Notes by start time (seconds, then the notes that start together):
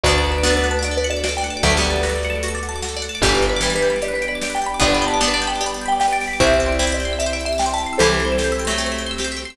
0.03 D2 A3 B3 D4 F#4 B4 D5, kick, closed hi-hat
0.11 A4
0.18 D5
0.24 F#5
0.31 B4 A5
0.38 D6
0.43 B3 D4 F#4, snare
0.50 A4
0.57 B4 D5
0.64 F#5, closed hi-hat
0.71 A5
0.79 F#4 D6
0.84 D5, closed hi-hat
0.91 A4
0.97 B4 D5
1.04 F#5, closed hi-hat
1.10 D5 A5
1.17 D6
1.24 F#4 D5, snare
1.29 A4
1.37 D5 G5
1.43 F#5, closed hi-hat
1.50 A5
1.57 D6
1.63 D2 F#3 A3 F#4 A4 B4 D5, kick, closed hi-hat
1.70 A4
1.77 G3 B3 D5
1.83 F#5, closed hi-hat
1.90 A5
1.96 D6
2.03 F#4, snare
2.09 A4
2.16 D5
2.23 F#5, closed hi-hat
2.30 A5
2.35 D6
2.43 F#4, closed hi-hat
2.48 A4
2.55 D5
2.63 F#5, closed hi-hat
2.69 A5
2.76 D6
2.82 F#4, snare
2.89 A4
2.97 D5
3.02 F#5, closed hi-hat
3.09 A5
3.15 D6
3.22 G1 E3 G3 B3 D4 G4 B4 D5, kick, closed hi-hat
3.29 B4
3.35 D5
3.42 G5, closed hi-hat
3.49 B4 B5
3.56 D6
3.61 E3 G3 G4, snare
3.70 B4
3.75 B4 D5
3.82 G5, closed hi-hat
3.90 B5
3.96 D6
4.02 G4 D5, closed hi-hat
4.08 B4
4.14 B4 D5
4.22 G5, closed hi-hat
4.28 D5 B5
4.35 D6
4.42 G4 D5, snare
4.50 B4
4.55 D5 G5
4.61 G5, closed hi-hat
4.66 B5
4.74 D6
4.80 G1 G3 B3 D4 G4 D5, kick, closed hi-hat
4.88 B4
4.93 D5 B5
5.01 G5, closed hi-hat
5.07 A5 B5
5.14 D6
5.20 B3 D4 G4, snare
5.28 B4
5.34 D5 A5
5.41 G5, closed hi-hat
5.47 G5 B5
5.55 D6
5.61 G4 D5, closed hi-hat
5.66 B4
5.74 D5
5.81 G5
5.86 G5 B5
5.92 D6
6.00 G4 G5, snare
6.08 B4
6.13 D5
6.20 G5, open hi-hat
6.27 B5
6.33 D6
6.40 C2 C4 E4 G4 C5 E5, kick, closed hi-hat
6.47 C5
6.53 E5
6.60 G5, closed hi-hat
6.66 D5 C6
6.72 E6
6.79 C4 E4 G4, snare
6.87 C5
6.92 D5 E5
7.00 G5, closed hi-hat
7.05 C6
7.13 E6
7.19 G4 E5, closed hi-hat
7.26 C5
7.33 D5 E5
7.39 G5, closed hi-hat
7.45 E5 C6
7.53 E6
7.58 G4 G5, snare
7.66 C5
7.74 E5 A5
7.78 G5, closed hi-hat
7.86 C6
7.93 E6
7.98 C2 E3 G3 C4 G4 A4 C5, closed hi-hat
8.06 C5
8.14 E5
8.19 G5, closed hi-hat
8.25 C6
8.32 E6
8.38 G4, snare
8.44 C5
8.52 E5
8.59 G5, closed hi-hat
8.65 F#3 A3 C6
8.71 E6
8.78 G4, closed hi-hat
8.86 C5
8.92 E5
8.98 G5, closed hi-hat
9.06 C6
9.11 E6
9.18 G4, snare
9.24 C5
9.32 E5
9.37 G5, closed hi-hat
9.45 C6
9.50 E6